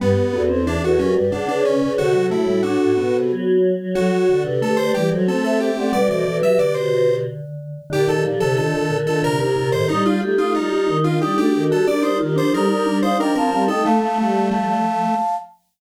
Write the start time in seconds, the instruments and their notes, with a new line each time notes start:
0.00 choir aahs G2, vibraphone G3, lead 1 (square) B3, flute G4 B4
0.16 choir aahs G2
0.33 choir aahs E2, vibraphone B3, flute F#4 A4
0.49 vibraphone C4, flute A4 C5
0.67 vibraphone E3, lead 1 (square) D4
0.82 choir aahs E2, flute F#4 A4, lead 1 (square) F#4
0.98 choir aahs F#2, vibraphone F#3, lead 1 (square) C#4, flute G4 B4
1.14 choir aahs G2, vibraphone G3, flute B4 D5
1.31 vibraphone C#3, choir aahs C#3, lead 1 (square) D4, flute D5 F#5
1.47 lead 1 (square) D4, flute B4 D5
1.64 lead 1 (square) C#4, flute B4 D5
1.81 choir aahs C#3, vibraphone C#3, flute B4 D5
1.98 choir aahs C3, vibraphone D3, lead 1 (square) F#4, flute F#4 A4
2.14 choir aahs C3, vibraphone F#3
2.30 choir aahs A2, vibraphone A3, lead 1 (square) E4
2.47 vibraphone G3
2.63 vibraphone D4, lead 1 (square) F#4
2.80 choir aahs A2
2.97 choir aahs B2, vibraphone B3
3.13 choir aahs C3
3.30 choir aahs F#3
3.79 choir aahs F#3
3.95 choir aahs F#3, vibraphone F#3, lead 1 (square) F#4, flute F#4 A4
4.12 choir aahs F#3
4.29 choir aahs D3, vibraphone D3
4.44 vibraphone C3, flute G4 B4
4.61 vibraphone A3, flute G4 B4, lead 1 (square) A4
4.77 choir aahs D3, flute G4 B4, lead 1 (square) C5
4.94 choir aahs E3, vibraphone G3, lead 1 (square) G4, flute B4 D5
5.11 choir aahs F#3, vibraphone F#3, flute A4 C5
5.27 choir aahs A3, vibraphone C4, lead 1 (square) A4, flute A4 C5
5.44 lead 1 (square) A4, flute C5 E5
5.60 lead 1 (square) G4, flute C5 E5
5.77 choir aahs A3, vibraphone C4, flute D5 F#5
5.93 choir aahs B2, vibraphone G3, flute B4 D5, lead 1 (square) D5
6.09 vibraphone E3, flute A4 C5, lead 1 (square) D5
6.25 vibraphone E3, flute F#4 A4
6.42 vibraphone F#3, flute G4 B4, lead 1 (square) E5
6.59 vibraphone D3, lead 1 (square) D5
6.74 lead 1 (square) C5
7.90 choir aahs A#2, vibraphone D3, flute D#4 G4, lead 1 (square) G4
8.08 vibraphone D#3, flute D#4 G4, lead 1 (square) A4
8.24 choir aahs D3, vibraphone F3, flute D#4 G4
8.40 choir aahs C3, vibraphone D3, lead 1 (square) A4
8.56 choir aahs A#2, vibraphone D#3, flute D4 F4, lead 1 (square) A4
8.74 choir aahs A#2, vibraphone D#3
8.90 choir aahs A#2, vibraphone D3
9.06 vibraphone D#3, flute D4 F4, lead 1 (square) A4
9.23 choir aahs C3, vibraphone D3, lead 1 (square) A#4
9.39 vibraphone C3, choir aahs C3, flute D#4 G4, lead 1 (square) A#4
9.56 choir aahs A#2, vibraphone C3, flute G4 A#4
9.72 choir aahs A2, vibraphone D#3, lead 1 (square) C5
9.88 choir aahs G3, lead 1 (square) D#4, flute D#4 G4, vibraphone D#4
10.05 flute D#4 G4, lead 1 (square) F4, vibraphone F4
10.21 choir aahs A3, flute D#4 G4, vibraphone G4
10.38 choir aahs A3, vibraphone D#4, lead 1 (square) F4
10.54 choir aahs G3, lead 1 (square) D#4, flute D#4 G4, vibraphone F4
10.71 choir aahs G3, vibraphone F4
10.88 choir aahs D#3, vibraphone D#4
11.04 flute D4 F4, lead 1 (square) F4, vibraphone F4
11.21 choir aahs G3, vibraphone D#4, lead 1 (square) G4
11.37 choir aahs A3, vibraphone D4, flute D4 F#4, lead 1 (square) G4
11.53 choir aahs D#3, vibraphone D4, flute F#4 A4
11.70 choir aahs G3, vibraphone F#4, lead 1 (square) A4
11.87 choir aahs G3, vibraphone D4, flute A#4 D5, lead 1 (square) D5
12.02 vibraphone D#4, lead 1 (square) C5
12.19 choir aahs D#3, vibraphone F4, flute G4 A#4
12.36 choir aahs F3, vibraphone D4, lead 1 (square) C5
12.53 choir aahs G3, vibraphone D#4, flute A4 C5, lead 1 (square) A#4
12.69 choir aahs G3, vibraphone D#4, flute A#4 D5
12.86 choir aahs G3, vibraphone D4
13.02 vibraphone D#4, lead 1 (square) C5, flute D5 F5
13.19 choir aahs F3, vibraphone D4, lead 1 (square) A#4, flute D#5 G5
13.35 choir aahs F3, vibraphone C4, lead 1 (square) A#4, flute F5 A5
13.51 choir aahs G3, vibraphone C4, flute F5 A5
13.68 choir aahs A3, vibraphone D#4, lead 1 (square) A4, flute D#5 G5
13.83 choir aahs A3, vibraphone A3, lead 1 (square) A3, flute F5 A5
14.01 vibraphone A3, flute F5 A5
14.18 choir aahs G3, vibraphone A3, flute F5 A5
14.51 vibraphone F3, lead 1 (square) A3, flute F5 A5
14.66 flute F5 A5